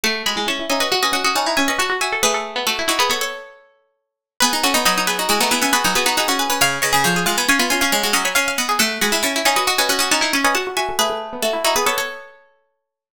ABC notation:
X:1
M:5/4
L:1/16
Q:1/4=137
K:Bmix
V:1 name="Pizzicato Strings"
[fa]2 [gb]2 [ac']2 [eg] [Bd] [df] [Bd] [df] [df] [fa]2 [eg] [Bd] [fa]2 [eg]2 | [GB]4 [FA]2 [DF] [GB] [Ac] [Ac]11 | [GB]2 [Ac]2 [Bd]2 [GB] [DF] [EG] [DF] [EG] [eg] [GB]2 [GB] [DF] [GB]2 [GB]2 | [c^e]2 [Bd]2 [Ac]2 [df] [gb] [eg] [gb] [eg] [eg] [ce]2 [df] [gb] [ce]2 [df]2 |
[fa]2 [gb]2 [ac']2 [eg] [Bd] [df] [Bd] [df] [df] [fa]2 [eg] [Bd] [fa]2 [eg]2 | [GB]4 [FA]2 [DF] [GB] [Ac] [Ac]11 |]
V:2 name="Pizzicato Strings"
A2 F E E E C2 F C C C C E C C F F z A | B A2 B, A, E E B, B,8 z4 | B2 F D D D B,2 F B, B, B, B, D B, B, F F z B | ^e2 c G G G ^E2 c E E C C F C c e e z G |
A2 F E E E C2 F C C C C E C C F F z A | B A2 B, A, E E B, B,8 z4 |]
V:3 name="Pizzicato Strings"
A,2 G, G, C2 D F F F F F D D C2 F2 F2 | A,16 z4 | B, D C B, F,4 G, A, B, C F F, F2 D C2 C | C,2 C, C, ^E,2 G, B, C B, C C G, G, F,2 C2 B,2 |
A,2 G, G, C2 D F F F F F D D C2 F2 F2 | A,16 z4 |]